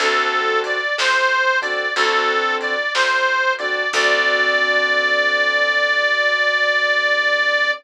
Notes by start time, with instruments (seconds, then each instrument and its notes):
0.00 electric bass (finger) D2, acoustic grand piano C4 D4 F#4 A4, harmonica A4, kick, ride
0.64 harmonica D5, ride
0.98 electric bass (finger) D2, harmonica C5, snare
1.61 acoustic grand piano C4 D4 F#4 A4, harmonica D5, kick, ride
1.96 electric bass (finger) D2, acoustic grand piano C4 D4 F#4 A4, harmonica A4, kick, ride
2.61 harmonica D5, ride
2.94 electric bass (finger) D2, harmonica C5, snare
3.58 acoustic grand piano C4 D4 F#4 A4, harmonica D5, ride
3.93 electric bass (finger) D2, acoustic grand piano C4 D4 F#4 A4, harmonica D5, kick, crash